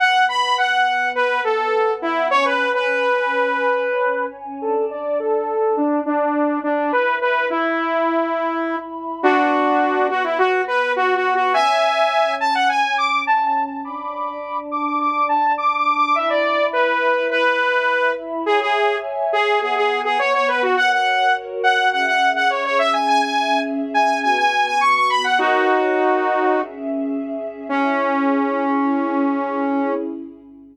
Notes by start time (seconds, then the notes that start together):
0.00 B3 B4 F#5
0.29 B5
0.58 F#5
1.15 B4
1.44 A4
2.02 E4
2.31 C#4 C#5 G#5
2.45 B4
2.74 B4
4.61 D4 A4 D5 A5
4.90 D5
5.19 A4
5.77 D4
6.06 D4
6.63 D4
6.92 E4 B4 E5 B5
7.21 B4
7.50 E4
9.22 B3 D4 F#4 B4 F#5
10.10 F#4
10.24 E4
10.38 F#4
10.67 B4
10.96 F#4
11.16 F#4
11.35 F#4
11.54 C#4 C#5 E5 G#5
12.40 A5
12.55 F#5
12.69 G#5
12.98 D6
13.27 A5
13.46 A5
13.66 A5
13.84 D4 D5 A5 B5 D6
14.71 D6
14.86 D6
15.00 D6
15.29 A5
15.58 D6
15.77 D6
15.96 D6
16.15 E4 E5 B5
16.30 D5
16.73 B4
17.31 B4
18.46 G#4 C#5 E5 G#5
18.61 G#4
19.33 G#4
19.61 B3 G#4 B4 F#5
19.76 G#4
20.05 G#4
20.19 C#5
20.34 C#5
20.48 B4
20.62 F#4
20.77 F#4 A#4 C#5 F#5
20.91 F#5
21.63 F#5
21.92 C#4 G#4 E5 F#5
22.07 F#5
22.36 F#5
22.50 C#5
22.64 C#5
22.79 E5
22.93 G#5
23.08 C#4 G#4 E5 G#5
23.22 G#5
23.94 G#5
24.23 B3 F#4 B4 G#5
24.37 G#5
24.66 G#5
24.81 C#6
24.95 C#6
25.10 B5
25.24 F#5
25.38 D#4 F#4 A#4 C#5
26.53 C#4 G#4 E5
27.69 C#4 E4 G#4